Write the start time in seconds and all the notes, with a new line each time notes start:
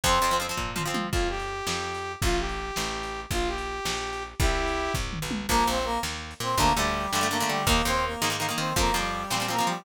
0.04 F2 F3 C4 C5, kick, closed hi-hat
0.22 F2 F3 C4
0.31 F3 C4, closed hi-hat
0.40 F3 C4
0.49 F3 C4
0.57 A#2, kick, floor tom
0.76 F3 C4, mid tom
0.85 F3 C4
0.94 F3, high tom
1.12 F2 F4, kick, crash
1.30 G4
1.40 closed hi-hat
1.67 F2, snare
1.94 closed hi-hat
2.22 A1 F4, kick, closed hi-hat
2.40 G4
2.49 closed hi-hat
2.76 A1, snare
3.03 closed hi-hat
3.31 A#1 F4, kick, closed hi-hat
3.48 G4
3.58 closed hi-hat
3.85 A#1, snare
4.13 closed hi-hat
4.40 C2 E4 G4, kick, closed hi-hat
4.68 closed hi-hat
4.94 C2, kick, floor tom
5.13 mid tom
5.22 B1
5.31 high tom
5.49 A#1 F3 A#3 A#4, kick, crash
5.67 A#1 C4 C5
5.76 closed hi-hat
5.85 A#3 A#4
6.03 D#2, snare
6.31 closed hi-hat
6.40 A#2 C4 C5
6.57 D2 D3 A3 A#3 A#4, kick, closed hi-hat
6.76 D2 D3 G3 A3 G4
6.85 closed hi-hat
7.11 G2 D3 G3 A3 G4, snare
7.21 D3 A3
7.31 D3 A3 A#3 A#4
7.40 D3 A3, closed hi-hat
7.49 D3 G3 G4
7.67 D#2 D#3 A#3 A#4, kick, closed hi-hat
7.85 D#2 D#3 A#3 C4 C5
7.94 closed hi-hat
8.06 A#3 A#4
8.22 G#2 D#3 A#3, snare
8.30 D#3 A#3
8.40 D#3 A#3
8.49 D#3 A#3, closed hi-hat
8.58 D#3 C4 C5
8.76 F2 F3 A#3 C4 A#4, kick, closed hi-hat
8.94 F2 F3 G3 C4 G4
9.04 closed hi-hat
9.30 A#2 F3 G3 C4 G4, snare
9.40 F3 C4
9.48 F3 A#3 C4 A#4
9.58 F3 C4, closed hi-hat
9.67 F3 G3 G4